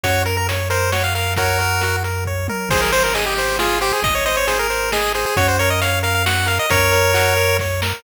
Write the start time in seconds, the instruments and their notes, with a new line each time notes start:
0.04 synth bass 1 F#2, lead 1 (square) F#4 C#5, kick, closed hi-hat
0.25 lead 1 (square) A#4, closed hi-hat
0.37 lead 1 (square) A#4
0.49 lead 1 (square) C#5, closed hi-hat
0.70 lead 1 (square) A#4 C5, closed hi-hat
0.92 lead 1 (square) F#4 C#5, snare
1.04 lead 1 (square) F5
1.14 lead 1 (square) A#4 F5, open hi-hat
1.36 lead 1 (square) F#4 A#4 C#5, kick, closed hi-hat
1.59 lead 1 (square) A#4, closed hi-hat
1.81 lead 1 (square) F#4, closed hi-hat
2.04 lead 1 (square) A#4, closed hi-hat
2.25 lead 1 (square) C#5, kick
2.48 lead 1 (square) A#4, high tom
2.69 synth bass 1 G#1, lead 1 (square) G#4 C5, kick, crash
2.82 lead 1 (square) A#4
2.92 lead 1 (square) C5, closed hi-hat
3.04 lead 1 (square) A#4
3.14 lead 1 (square) G#4 D#5, closed hi-hat
3.26 lead 1 (square) G4
3.36 lead 1 (square) C5, closed hi-hat
3.59 lead 1 (square) F4 G#4, snare
3.81 lead 1 (square) G4 C5, closed hi-hat
3.93 lead 1 (square) G#4
4.02 synth bass 1 G#1, lead 1 (square) D#5, kick, closed hi-hat
4.15 lead 1 (square) C#5
4.26 lead 1 (square) C5 D#5, closed hi-hat
4.37 lead 1 (square) C#5
4.47 lead 1 (square) G#4 C5, closed hi-hat
4.59 lead 1 (square) A#4
4.70 lead 1 (square) C5, closed hi-hat
4.92 lead 1 (square) G#4 D#5, snare
5.15 lead 1 (square) G#4 C5, closed hi-hat
5.26 lead 1 (square) G#4
5.36 synth bass 1 F#2, lead 1 (square) F#4 C#5, kick, closed hi-hat
5.48 lead 1 (square) C5
5.59 lead 1 (square) A#4 C#5, closed hi-hat
5.70 lead 1 (square) D#5
5.81 lead 1 (square) C#5 F5, closed hi-hat
6.03 lead 1 (square) A#4 F5, closed hi-hat
6.14 lead 1 (square) F5
6.26 lead 1 (square) F#4 F#5, snare
6.46 lead 1 (square) A#4 F5, closed hi-hat
6.59 lead 1 (square) D#5
6.70 synth bass 1 F#2, lead 1 (square) A#4 C#5, kick, closed hi-hat
6.92 lead 1 (square) A#4, closed hi-hat
7.14 lead 1 (square) F#4, closed hi-hat
7.36 lead 1 (square) A#4, closed hi-hat
7.59 lead 1 (square) C#5, kick, snare
7.82 lead 1 (square) A#4, snare